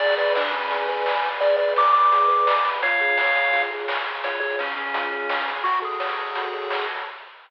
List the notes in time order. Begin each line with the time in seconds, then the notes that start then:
0.00 G#1 G#4 D5, kick, crash
0.09 closed hi-hat
0.17 B4 D5, closed hi-hat
0.26 closed hi-hat
0.35 D4 D5, snare
0.44 kick, closed hi-hat
0.51 C#4 B4, closed hi-hat
0.62 kick, closed hi-hat
0.70 G#4, kick, closed hi-hat
0.79 closed hi-hat
0.88 B4, closed hi-hat
0.97 closed hi-hat
1.06 D5, snare
1.15 closed hi-hat
1.24 B4, closed hi-hat
1.32 open hi-hat
1.40 G#1 G#4 D5, kick, closed hi-hat
1.50 closed hi-hat
1.57 B4 D5, closed hi-hat
1.68 closed hi-hat
1.76 D5 D6, snare
1.85 kick, closed hi-hat
1.93 B4 D6, closed hi-hat
2.03 kick, closed hi-hat
2.12 G#4, kick, closed hi-hat
2.21 closed hi-hat
2.28 B4, closed hi-hat
2.38 closed hi-hat
2.46 D5, snare
2.56 closed hi-hat
2.64 B4, kick, closed hi-hat
2.74 open hi-hat
2.82 C#2 F4 C#5 F5, kick, closed hi-hat
2.91 closed hi-hat
3.00 G#4, closed hi-hat
3.09 closed hi-hat
3.17 C#5, snare
3.26 closed hi-hat
3.35 G#4, closed hi-hat
3.44 kick, closed hi-hat
3.53 F4, kick, closed hi-hat
3.62 closed hi-hat
3.71 G#4, closed hi-hat
3.79 closed hi-hat
3.88 C#5, snare
3.97 closed hi-hat
4.06 G#4, closed hi-hat
4.15 closed hi-hat
4.24 C#2 F4 C#5, kick, closed hi-hat
4.32 closed hi-hat
4.40 G#4 C#5, closed hi-hat
4.50 closed hi-hat
4.58 C#4 C#5, snare
4.68 kick, closed hi-hat
4.76 C#4 G#4, closed hi-hat
4.85 kick, closed hi-hat
4.94 F4, kick, closed hi-hat
5.03 closed hi-hat
5.12 G#4, closed hi-hat
5.20 closed hi-hat
5.29 C#5, snare
5.38 closed hi-hat
5.47 G#4, kick, closed hi-hat
5.56 closed hi-hat
5.64 F#2 F#4, kick, closed hi-hat
5.73 closed hi-hat
5.82 G#4 A4, closed hi-hat
5.91 closed hi-hat
6.00 C#5, snare
6.09 kick, closed hi-hat
6.18 A4, closed hi-hat
6.26 kick, closed hi-hat
6.35 F#2 F#4, kick, closed hi-hat
6.44 closed hi-hat
6.53 A4, closed hi-hat
6.62 closed hi-hat
6.70 C#5, snare
6.79 closed hi-hat
6.88 A4, closed hi-hat
6.97 closed hi-hat